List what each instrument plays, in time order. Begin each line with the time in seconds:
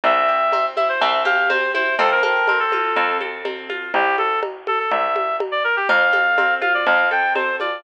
0.04 electric bass (finger) C2, orchestral harp C4, clarinet E5, cowbell, low conga
0.28 orchestral harp G4
0.52 orchestral harp C4, cowbell, high conga
0.76 orchestral harp E4, clarinet E5, high conga
0.89 clarinet C5
1.01 electric bass (finger) C2, orchestral harp C4, clarinet E5, cowbell, low conga
1.25 orchestral harp G4, clarinet F5, high conga
1.50 orchestral harp C4, clarinet C5, cowbell, high conga
1.74 orchestral harp E4, clarinet C5, high conga
1.99 electric bass (finger) F2, orchestral harp C4, clarinet A4, cowbell, low conga
2.11 clarinet A#4
2.23 orchestral harp A4, clarinet A#4, high conga
2.47 orchestral harp C4, clarinet A#4, cowbell, high conga
2.59 clarinet A4
2.72 orchestral harp F4, high conga
2.96 electric bass (finger) F2, orchestral harp C4, cowbell, low conga
3.21 orchestral harp A4, high conga
3.45 orchestral harp C4, cowbell, high conga
3.70 orchestral harp F4, high conga
3.94 electric bass (finger) C2, clarinet G4, cowbell, low conga
4.18 clarinet A4, high conga
4.43 cowbell, high conga
4.67 clarinet A4, high conga
4.79 clarinet A4
4.91 electric bass (finger) C2, clarinet E5, cowbell, low conga
5.16 high conga
5.40 cowbell, high conga
5.52 clarinet D5
5.64 clarinet A#4
5.76 clarinet G4
5.89 electric bass (finger) F2, orchestral harp C4, clarinet F5, cowbell, low conga
6.13 orchestral harp A4, high conga
6.38 orchestral harp C4, cowbell, high conga
6.61 orchestral harp F4, clarinet F5, high conga
6.74 clarinet D5
6.86 electric bass (finger) F2, orchestral harp C4, clarinet F5, cowbell, low conga
7.11 orchestral harp A4, clarinet G5
7.35 orchestral harp C4, clarinet C5, cowbell, high conga
7.60 orchestral harp F4, clarinet D5, high conga